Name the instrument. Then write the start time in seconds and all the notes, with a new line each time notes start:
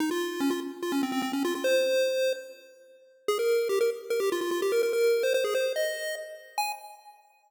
lead 1 (square)
0.00 D#4
0.11 F4
0.40 C#4
0.50 F4
0.83 F4
0.92 C#4
1.03 C4
1.12 C4
1.22 C4
1.33 C#4
1.45 F4
1.55 F4
1.64 C5
3.28 G#4
3.39 A#4
3.69 G4
3.81 A#4
4.10 A#4
4.20 G4
4.32 F4
4.41 F4
4.51 F4
4.62 G4
4.72 A#4
4.83 A#4
4.93 A#4
5.23 C5
5.34 C5
5.44 G#4
5.55 C5
5.76 D#5
6.58 G#5